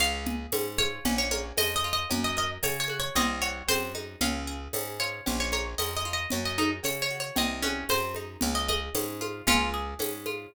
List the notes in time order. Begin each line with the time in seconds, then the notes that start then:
0.00 C#2 C#4 F5, cowbell
0.26 G#4, low conga
0.52 G#2 C#4, tambourine, cowbell, high conga
0.78 F4 C#5, high conga
1.05 A#1 C#4, cowbell, low conga
1.18 C#5
1.31 A#4 C#5, high conga
1.57 F2 C#4 D#5, tambourine, cowbell, high conga
1.76 D#5
1.84 F4
1.93 D#5
2.10 F#2 C#4, cowbell, low conga
2.24 D#5
2.37 A#4 D#5
2.63 C#3 C#4 C#5, tambourine, cowbell, high conga
2.80 C#5
2.88 F#4, high conga
3.00 C#5
3.15 C2 C4 D#5, cowbell, low conga
3.42 F#4 C#5
3.68 F#2 C4 C5, tambourine, cowbell, high conga
3.95 D#4, high conga
4.21 C#2 C#4 F5, cowbell, low conga
4.47 G#4
4.73 G#2 C#4, tambourine, cowbell, high conga
5.00 F4 C#5
5.26 A#1 C#4, cowbell, low conga
5.40 C#5
5.52 A#4 C#5, high conga
5.78 F2 C#4 D#5, tambourine, cowbell, high conga
5.96 D#5
6.05 F4
6.13 D#5
6.30 F#2 C#4, cowbell, low conga
6.45 D#5
6.58 D#4 A#4, high conga
6.83 C#3 C#4 C#5, tambourine, cowbell, high conga
7.02 C#5
7.11 F#4
7.20 C#5
7.36 C2 C4 D#5, cowbell, low conga
7.63 C#4 F#4, high conga
7.89 F#2 C4 C5, tambourine, cowbell, high conga
8.15 D#4, high conga
8.41 C#2 C#4, cowbell, low conga
8.55 D#5
8.68 G#4 D#5, high conga
8.95 G#2 C#4, tambourine, cowbell, high conga
9.21 F4, high conga
9.47 C#2 C#4 F4, cowbell, low conga
9.74 G#4
9.99 G#2 C#4, tambourine, cowbell, high conga
10.26 F4, high conga